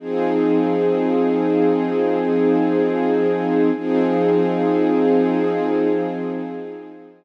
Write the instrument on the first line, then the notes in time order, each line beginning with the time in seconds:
string ensemble 1
0.00 F3 C4 D#4 G#4
3.75 F3 C4 D#4 G#4